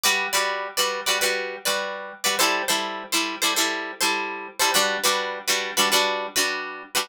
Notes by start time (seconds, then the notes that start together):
0.04 G3 F#4 B4 D5
0.33 G3 F#4 B4 D5
0.77 G3 F#4 B4 D5
1.06 G3 F#4 B4 D5
1.21 G3 F#4 B4 D5
1.65 G3 F#4 B4 D5
2.24 G3 F#4 B4 D5
2.39 G3 E4 A4 C5
2.68 G3 E4 A4 C5
3.12 G3 E4 A4 C5
3.42 G3 E4 A4 C5
3.56 G3 E4 A4 C5
4.01 G3 E4 A4 C5
4.60 G3 E4 A4 C5
4.74 G3 D4 F#4 B4
5.04 G3 D4 F#4 B4
5.48 G3 D4 F#4 B4
5.77 G3 D4 F#4 B4
5.92 G3 D4 F#4 B4
6.36 G3 D4 F#4 B4
6.95 G3 D4 F#4 B4